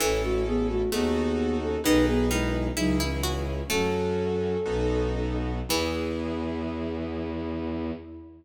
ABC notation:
X:1
M:2/2
L:1/8
Q:1/2=65
K:E
V:1 name="Flute"
[CA] [A,F] [B,G] [A,F] [B,G]3 [CA] | [DB] [B,G] [G,E]2 [F,D] [E,C] [E,C]2 | "^rit." [CA]6 z2 | E8 |]
V:2 name="Harpsichord"
E,4 A,4 | D,2 D,2 E E F z | "^rit." A,3 z5 | E,8 |]
V:3 name="Acoustic Grand Piano"
[CEA]4 [DFA]4 | [DGB]4 [CEG]4 | "^rit." [CFA]4 [B,DFA]4 | [B,EG]8 |]
V:4 name="Violin" clef=bass
A,,,4 D,,4 | B,,,4 C,,4 | "^rit." F,,4 B,,,4 | E,,8 |]